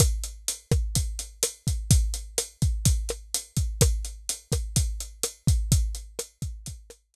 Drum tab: HH |xxxxxxxx|xxxxxxxx|xxxxxxxx|xxxxxxx-|
SD |r--r--r-|--r--r--|r--r--r-|--r--r--|
BD |o--oo--o|o--oo--o|o--oo--o|o--oo---|